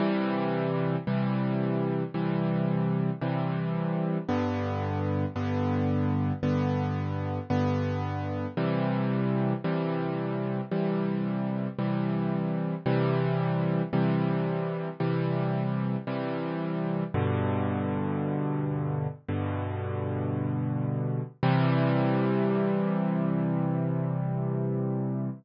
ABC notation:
X:1
M:4/4
L:1/8
Q:1/4=56
K:C
V:1 name="Acoustic Grand Piano"
[C,E,G,]2 [C,E,G,]2 [C,E,G,]2 [C,E,G,]2 | [G,,D,B,]2 [G,,D,B,]2 [G,,D,B,]2 [G,,D,B,]2 | [C,E,G,]2 [C,E,G,]2 [C,E,G,]2 [C,E,G,]2 | [C,E,G,]2 [C,E,G,]2 [C,E,G,]2 [C,E,G,]2 |
[G,,B,,D,]4 [G,,B,,D,]4 | [C,E,G,]8 |]